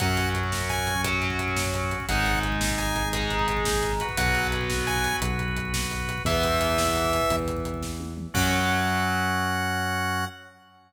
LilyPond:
<<
  \new Staff \with { instrumentName = "Lead 2 (sawtooth)" } { \time 12/8 \key fis \mixolydian \tempo 4. = 115 fis''4 r4 gis''4 r2. | fis''4 r4 gis''4 r2. | fis''4 r4 gis''4 r2. | e''2.~ e''8 r2 r8 |
fis''1. | }
  \new Staff \with { instrumentName = "Overdriven Guitar" } { \time 12/8 \key fis \mixolydian <fis cis'>2. <fis cis'>2. | <gis dis'>2. <gis dis'>2. | <fis b>1. | <e b>1. |
<fis cis'>1. | }
  \new Staff \with { instrumentName = "Drawbar Organ" } { \time 12/8 \key fis \mixolydian <cis' fis'>1. | <dis' gis'>1~ <dis' gis'>4. <fis' b'>8~ | <fis' b'>1. | r1. |
<cis' fis'>1. | }
  \new Staff \with { instrumentName = "Synth Bass 1" } { \clef bass \time 12/8 \key fis \mixolydian fis,1. | gis,,1. | b,,2. b,,2. | e,2. e,2. |
fis,1. | }
  \new DrumStaff \with { instrumentName = "Drums" } \drummode { \time 12/8 <hh bd>16 bd16 <hh bd>16 bd16 <hh bd>16 bd16 <bd sn>16 bd16 <hh bd>16 bd16 <hh bd>16 bd16 <hh bd>16 bd16 <hh bd>16 bd16 <hh bd>16 bd16 <bd sn>16 bd16 <hh bd>16 bd16 <hh bd>16 bd16 | <hh bd>16 bd16 <hh bd>16 bd16 <hh bd>16 bd16 <bd sn>16 bd16 <hh bd>16 bd16 <hh bd>16 bd16 <hh bd>16 bd16 <hh bd>16 bd16 <hh bd>16 bd16 <bd sn>16 bd16 <hh bd>16 bd16 <hh bd>16 bd16 | <hh bd>16 bd16 <hh bd>16 bd16 <hh bd>16 bd16 <bd sn>16 bd16 <hh bd>16 bd16 <hh bd>16 bd16 <hh bd>16 bd16 <hh bd>16 bd16 <hh bd>16 bd16 <bd sn>16 bd16 <hh bd>16 bd16 <hh bd>16 bd16 | <hh bd>16 bd16 <hh bd>16 bd16 <hh bd>16 bd16 <bd sn>16 bd16 <hh bd>16 bd16 <hh bd>16 bd16 <hh bd>16 bd16 <hh bd>16 bd16 <hh bd>16 bd16 <bd sn>8 tommh8 toml8 |
<cymc bd>4. r4. r4. r4. | }
>>